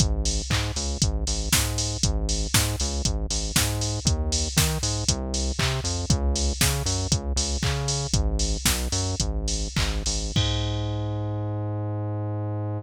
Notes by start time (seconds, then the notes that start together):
0.00 G#1, kick, closed hi-hat
0.25 open hi-hat
0.50 G#2, kick, clap
0.76 C#2, open hi-hat
1.02 G#1, kick, closed hi-hat
1.27 G#1, open hi-hat
1.53 G#2, kick, snare
1.78 open hi-hat
2.03 G#1, kick, closed hi-hat
2.29 open hi-hat
2.54 G#2, kick, snare
2.80 C#2, open hi-hat
3.05 G#1, kick, closed hi-hat
3.30 G#1, open hi-hat
3.56 G#2, kick, snare
3.81 open hi-hat
4.05 D#2, kick, closed hi-hat
4.32 open hi-hat
4.57 D#3, kick, snare
4.83 G#2, open hi-hat
5.08 C2, kick, closed hi-hat
5.34 open hi-hat
5.59 C3, kick, clap
5.84 F2, open hi-hat
6.10 C#2, kick, closed hi-hat
6.36 open hi-hat
6.61 C#3, kick, snare
6.86 F#2, open hi-hat
7.11 C#2, kick, closed hi-hat
7.36 C#2, open hi-hat
7.63 C#3, kick, clap
7.88 open hi-hat
8.13 G#1, kick, closed hi-hat
8.39 open hi-hat
8.65 B1, kick, snare
8.92 F#2, open hi-hat
9.20 G#1, kick, closed hi-hat
9.48 open hi-hat
9.77 G#1, kick, clap
10.06 G#1, open hi-hat
10.36 G#2, kick, crash